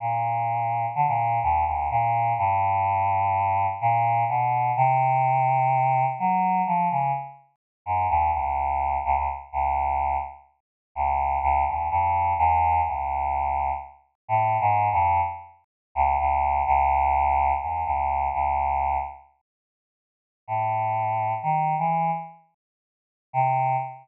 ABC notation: X:1
M:5/4
L:1/16
Q:1/4=126
K:none
V:1 name="Choir Aahs" clef=bass
^A,,8 D, A,,3 ^D,,2 =D,,2 A,,4 | G,,12 ^A,,4 B,,4 | C,12 ^F,4 =F,2 ^C,2 | z6 ^F,,2 ^D,,2 ^C,,6 C,, C,, z2 |
^C,,6 z6 C,,4 C,,2 ^D,,2 | F,,4 E,,4 ^C,,8 z4 | (3A,,4 ^G,,4 F,,4 z6 ^C,,2 C,,4 | ^C,,8 E,,2 C,,4 C,,6 |
z12 A,,8 | ^D,3 E,3 z10 C,4 |]